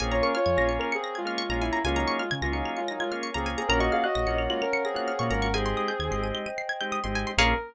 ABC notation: X:1
M:4/4
L:1/16
Q:1/4=130
K:Bbm
V:1 name="Ocarina"
[CA] [Fd] [DB] [Fd]3 z [DB] [CA]2 [A,F]4 =E2 | [A,F] [G,E]2 [A,F] z [A,F] [G,E]2 [A,F] [G,E] [A,F] z2 [CA] z [CA] | [DB] [Ge] [Af] [Ge]3 z [A,F] [DB]2 [CA]4 [DB]2 | [CA]6 z10 |
B4 z12 |]
V:2 name="Drawbar Organ"
[B,DFA]5 [B,DFA]6 [B,DFA]2 [B,DFA]3 | [B,DFA]5 [B,DFA]6 [B,DFA]2 [B,DFA]3 | [B,DFG]5 [B,DFG]6 [B,DFG]2 [B,DFG]3 | [A,CE=G]5 [A,CEG]6 [A,CEG]2 [A,CEG]3 |
[B,DFA]4 z12 |]
V:3 name="Pizzicato Strings"
a b d' f' a' b' d'' f'' d'' b' a' f' d' b a b | a b d' f' a' b' d'' f'' d'' b' a' f' d' b a b | b d' f' g' b' d'' f'' g'' f'' d'' b' g' f' d' b d' | a c' e' =g' a' c'' e'' =g'' e'' c'' a' g' e' c' a c' |
[ABdf]4 z12 |]
V:4 name="Synth Bass 1" clef=bass
B,,,4 F,, B,,,8 B,,,3 | D,,4 D, D,,8 D,,3 | B,,,4 B,,, B,,,8 B,, A,,,2- | A,,,4 E,, A,,,8 A,,,3 |
B,,,4 z12 |]
V:5 name="Pad 5 (bowed)"
[Bdfa]16 | [Bdfa]16 | [Bdfg]16 | [Ace=g]16 |
[B,DFA]4 z12 |]